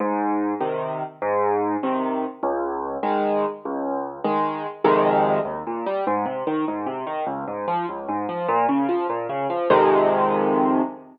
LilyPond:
\new Staff { \clef bass \time 6/8 \key aes \major \tempo 4. = 99 aes,4. <c ees>4. | aes,4. <c ees>4. | des,4. <ees aes>4. | des,4. <ees aes>4. |
\key f \minor <f, c ees aes>4. ees,8 bes,8 g8 | aes,8 c8 ees8 aes,8 c8 ees8 | des,8 aes,8 f8 des,8 aes,8 f8 | bes,8 des8 f8 bes,8 des8 f8 |
<f, c ees aes>2. | }